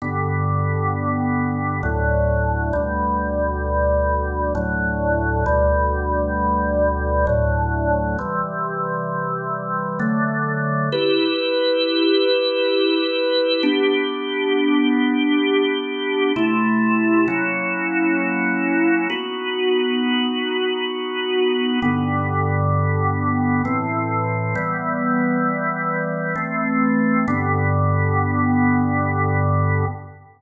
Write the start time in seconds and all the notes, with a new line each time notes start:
0.02 G2 D3 B3
1.83 D2 A2 F#3
2.73 D2 B2 G3
4.55 D2 A2 F#3
5.46 D2 B2 G3
7.27 D2 A2 F#3
8.19 C3 E3 G3
9.99 D3 F#3 A3
10.92 E4 G4 B4
13.63 B3 D4 G4
16.36 C3 A3 E4
17.28 F#3 A#3 C#4 E4
19.10 B3 D#4 F#4
21.82 G2 D3 B3
23.65 A2 E3 C4
24.55 E3 G3 B3
26.35 E3 A3 C4
27.28 G2 D3 B3